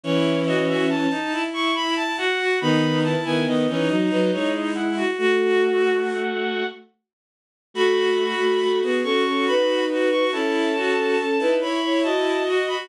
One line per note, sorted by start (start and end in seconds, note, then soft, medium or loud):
0.04 1.07 E3 medium
0.04 1.07 C#4 loud
0.04 0.44 E4 medium
0.04 0.40 C#5 loud
0.46 0.86 F#4 medium
0.46 0.67 D#5 medium
0.68 0.88 E5 loud
0.89 1.43 A5 medium
1.11 1.31 D#4 medium
1.32 2.11 E4 medium
1.54 1.74 C#6 medium
1.75 1.95 B5 loud
1.96 2.17 A5 loud
2.18 2.38 F#4 medium
2.18 2.59 F#5 loud
2.39 2.60 F#4 medium
2.61 3.15 D#3 medium
2.61 3.15 B3 medium
2.61 3.02 D#4 medium
2.61 2.99 B5 loud
3.04 3.45 E4 medium
3.04 3.24 A5 medium
3.25 3.46 D#3 medium
3.25 3.46 B3 medium
3.25 3.46 G#5 medium
3.46 3.67 D#3 medium
3.46 3.67 B3 medium
3.46 4.03 D#5 medium
3.68 3.89 E3 medium
3.68 3.89 C#4 loud
3.68 3.88 D#4 medium
3.89 4.09 F#3 medium
3.89 4.09 D#4 medium
3.89 4.68 D#4 medium
4.10 4.30 F#3 medium
4.10 4.30 D#4 medium
4.10 4.31 B4 medium
4.32 5.02 G#3 medium
4.32 5.02 E4 medium
4.32 4.53 C#5 loud
4.54 4.74 D#5 medium
4.75 4.95 E4 medium
4.75 5.10 F#5 loud
4.97 5.17 F#4 medium
5.18 6.63 A3 medium
5.18 6.00 F#4 medium
5.18 6.63 F#4 medium
5.18 6.66 F#5 loud
7.74 8.34 A3 medium
7.74 8.34 F#4 medium
7.74 8.10 F#4 medium
7.74 8.78 B5 medium
8.18 8.52 F#4 medium
8.40 8.60 A3 medium
8.40 8.60 F#4 medium
8.61 8.81 A3 medium
8.61 8.81 F#4 medium
8.82 9.03 B3 medium
8.82 9.03 F#4 medium
8.82 9.03 G#4 medium
9.03 9.24 C#4 medium
9.03 9.85 F#4 medium
9.03 9.24 A4 medium
9.03 9.45 C#6 medium
9.26 9.46 C#4 medium
9.26 9.46 A4 medium
9.46 10.24 D#4 medium
9.46 10.24 B4 medium
9.46 9.85 B5 medium
9.89 10.10 F#4 medium
10.11 10.31 F#4 medium
10.11 10.31 C#6 medium
10.32 10.95 C#4 medium
10.32 10.72 E4 medium
10.32 10.95 A4 medium
10.32 11.54 A5 medium
10.75 11.15 F#4 medium
10.96 11.16 C#4 medium
10.96 11.16 A4 medium
11.18 11.38 C#4 medium
11.18 11.38 A4 medium
11.39 11.60 D#4 medium
11.39 11.60 E4 medium
11.39 11.60 B4 medium
11.60 11.81 E4 medium
11.60 12.42 E4 medium
11.60 11.81 C#5 medium
11.60 11.99 B5 medium
11.83 12.03 E4 medium
11.83 12.03 C#5 medium
12.04 12.77 F#4 medium
12.04 12.77 D#5 medium
12.04 12.43 A5 medium
12.46 12.67 F#4 medium
12.68 12.88 F#4 medium
12.68 12.88 B5 medium